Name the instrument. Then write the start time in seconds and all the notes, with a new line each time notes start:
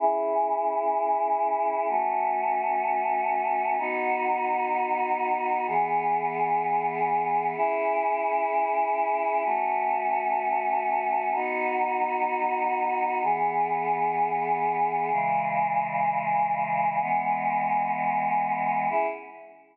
choir aahs
0.00 C#4 E4 G#4
1.89 A3 C#4 F#4
3.78 B3 D#4 F#4
5.67 E3 B3 G#4
7.56 C#4 E4 G#4
9.45 A3 C#4 F#4
11.34 B3 D#4 F#4
13.23 E3 B3 G#4
15.12 C#3 E3 G#3
17.01 E3 G#3 B3
18.90 C#4 E4 G#4